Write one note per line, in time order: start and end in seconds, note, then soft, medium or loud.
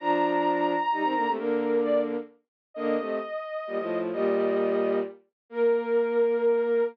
0.00 0.75 F3 loud
0.00 0.75 D4 loud
0.00 1.30 A#5 medium
0.92 1.03 G3 medium
0.92 1.03 D#4 medium
1.03 1.14 D#3 medium
1.03 1.14 C4 medium
1.15 1.25 D3 medium
1.15 1.25 A#3 loud
1.26 1.37 C3 medium
1.26 1.37 A3 medium
1.37 2.16 D3 medium
1.37 2.16 A#3 loud
1.37 1.78 A#4 medium
1.82 2.00 D5 medium
2.74 2.96 D3 loud
2.74 2.96 A#3 loud
2.74 3.99 D#5 medium
2.98 3.19 C3 medium
2.98 3.19 A3 medium
3.67 3.78 A#2 medium
3.67 3.78 G3 medium
3.78 4.11 A2 medium
3.78 4.11 F3 medium
4.12 5.00 A#2 loud
4.12 5.00 G3 loud
4.12 4.98 D#5 medium
5.50 6.82 A#3 loud
5.50 6.84 A#4 loud